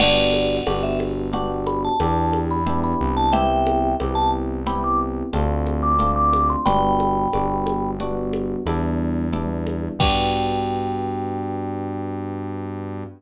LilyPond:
<<
  \new Staff \with { instrumentName = "Vibraphone" } { \time 5/4 \key g \mixolydian \tempo 4 = 90 <d'' fis''>4 fis''16 e''16 r8 fis''16 r16 b''16 a''4 b''8 b''8 a''16 | <e'' g''>4 r16 a''16 r8 b''16 d'''16 r4 r16 d'''8 d'''8 c'''16 | <g'' b''>2 r2. | g''1~ g''4 | }
  \new Staff \with { instrumentName = "Electric Piano 1" } { \time 5/4 \key g \mixolydian <b d' fis' g'>4 <b d' fis' g'>4 <b d' fis' g'>4 <b d' e' g'>4 <b d' e' g'>4 | <b c' e' g'>4 <b c' e' g'>4 <b c' e' g'>4 <a c' d' f'>4 <a c' d' f'>4 | <g b d' fis'>4 <g b d' fis'>4 <g b d' fis'>4 <g b d' e'>4 <g b d' e'>4 | <b d' fis' g'>1~ <b d' fis' g'>4 | }
  \new Staff \with { instrumentName = "Synth Bass 1" } { \clef bass \time 5/4 \key g \mixolydian g,,4 g,,2 e,4. c,8~ | c,4 c,2 d,2 | g,,4 g,,2 e,2 | g,1~ g,4 | }
  \new DrumStaff \with { instrumentName = "Drums" } \drummode { \time 5/4 <cgl cymc>8 cgho8 cgho8 cgho8 cgl8 cgho8 cgho8 cgho8 cgl4 | cgl8 cgho8 cgho4 cgl4 cgho8 cgho8 cgl8 cgho8 | cgl8 cgho8 cgho8 cgho8 cgl8 cgho8 cgho4 cgl8 cgho8 | <cymc bd>4 r4 r4 r4 r4 | }
>>